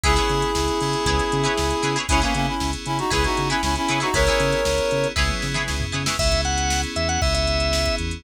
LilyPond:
<<
  \new Staff \with { instrumentName = "Clarinet" } { \time 4/4 \key cis \dorian \tempo 4 = 117 <e' gis'>1 | <cis' e'>16 <ais cis'>16 <ais cis'>16 <cis' e'>8 r16 <cis' e'>16 <dis' fis'>16 <e' gis'>16 <dis' fis'>8 <cis' e'>16 <cis' e'>16 <cis' e'>8 <dis' fis'>16 | <ais' cis''>2 r2 | r1 | }
  \new Staff \with { instrumentName = "Drawbar Organ" } { \time 4/4 \key cis \dorian r1 | r1 | r1 | e''8 fis''8. r16 e''16 fis''16 e''16 e''4~ e''16 r8 | }
  \new Staff \with { instrumentName = "Acoustic Guitar (steel)" } { \time 4/4 \key cis \dorian <e' gis' b' cis''>16 <e' gis' b' cis''>4.~ <e' gis' b' cis''>16 <e' gis' b' cis''>8. <e' gis' b' cis''>8. <e' gis' b' cis''>16 <e' gis' b' cis''>16 | <e' gis' b' cis''>16 <e' gis' b' cis''>4.~ <e' gis' b' cis''>16 <e' gis' b' cis''>8. <e' gis' b' cis''>8. <e' gis' b' cis''>16 <e' gis' b' cis''>16 | <e' gis' b' cis''>16 <e' gis' b' cis''>4.~ <e' gis' b' cis''>16 <e' gis' b' cis''>8. <e' gis' b' cis''>8. <e' gis' b' cis''>16 <e' gis' b' cis''>16 | r1 | }
  \new Staff \with { instrumentName = "Electric Piano 2" } { \time 4/4 \key cis \dorian <b cis' e' gis'>4 <b cis' e' gis'>8 <b cis' e' gis'>4. <b cis' e' gis'>4 | <b cis' e' gis'>4 <b cis' e' gis'>4 <b cis' e' gis'>4 <b cis' e' gis'>4 | <b cis' e' gis'>4 <b cis' e' gis'>4 <b cis' e' gis'>4 <b cis' e' gis'>4 | <b cis' e' gis'>2 <b cis' e' gis'>2 | }
  \new Staff \with { instrumentName = "Synth Bass 1" } { \clef bass \time 4/4 \key cis \dorian cis,8 cis8 cis,8 cis8 cis,8 cis8 cis,8 cis8 | cis,8 cis8 cis,8 cis8 cis,8 cis8 cis,8 cis8 | cis,8 cis8 cis,8 cis8 cis,8 cis8 cis,8 cis8 | cis,4. e,8 cis,4. e,8 | }
  \new DrumStaff \with { instrumentName = "Drums" } \drummode { \time 4/4 <hh bd>16 <hh sn>16 hh16 hh16 sn16 hh16 hh16 hh16 <hh bd>16 <hh sn>16 hh16 hh16 sn16 hh16 <hh sn>16 hh16 | <hh bd>16 hh16 hh8 sn16 hh16 hh16 hh16 <hh bd>16 <hh sn>16 hh16 hh16 sn16 hh16 <hh sn>16 hh16 | <hh bd>16 hh16 hh16 hh16 sn16 hh16 hh16 hh16 <bd sn>16 tommh16 sn16 toml16 sn16 tomfh8 sn16 | <cymc bd>16 <hh bd>16 hh16 hh16 sn16 hh16 hh16 hh16 bd16 hh16 hh16 hh16 sn16 <hh bd>16 hh16 hh16 | }
>>